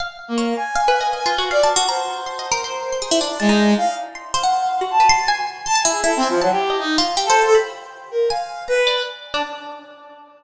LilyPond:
<<
  \new Staff \with { instrumentName = "Brass Section" } { \time 5/4 \tempo 4 = 159 r8. bes8. aes''2~ aes''8 d''8 r8 | c''1 aes4 | f''8 r4 f''4. a''4 r4 | \tuplet 3/2 { a''8 aes''8 aes'8 a'8 c'8 f8 } ges16 g'8. ees'8 r8. a'8 a'16 |
r4. bes'8 f''4 b'4 r4 | }
  \new Staff \with { instrumentName = "Pizzicato Strings" } { \time 5/4 f''8 r8 des''16 r8. \tuplet 3/2 { f''8 b'8 ees''8 ees''8 f'8 ges'8 f''8 a''8 ges'8 } | bes''8 r8 \tuplet 3/2 { c'''8 ees''8 bes'8 } c''8 r16 c'''16 aes'16 e'16 d'8 a''16 ees'8. | r4 c'''8 c''16 ges''4 ges'16 r16 b'16 c'''8 aes''4 | c'''16 a''16 e'8 e'8 aes''8 a''8. ees''8. f'8 \tuplet 3/2 { g'8 c''8 c''8 } |
b''4. r8 aes''4 bes''16 r16 d''16 r4 d'16 | }
>>